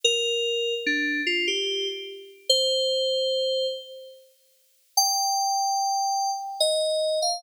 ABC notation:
X:1
M:3/4
L:1/16
Q:1/4=73
K:Eb
V:1 name="Electric Piano 2"
B4 D2 F G2 z3 | c6 z6 | g8 e3 f |]